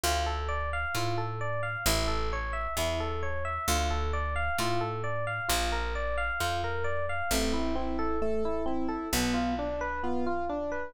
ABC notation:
X:1
M:2/4
L:1/16
Q:1/4=66
K:Dm
V:1 name="Electric Piano 1"
F A d f F A d f | E A ^c e E A c e | F A d f F A d f | F B d f F B d f |
[K:Am] A, E C A A, E C A | B, F D B B, F D B |]
V:2 name="Acoustic Grand Piano"
z8 | z8 | z8 | z8 |
[K:Am] C2 E2 A2 E2 | B,2 D2 F2 D2 |]
V:3 name="Electric Bass (finger)" clef=bass
D,,4 A,,4 | A,,,4 E,,4 | D,,4 A,,4 | B,,,4 F,,4 |
[K:Am] A,,,8 | B,,,8 |]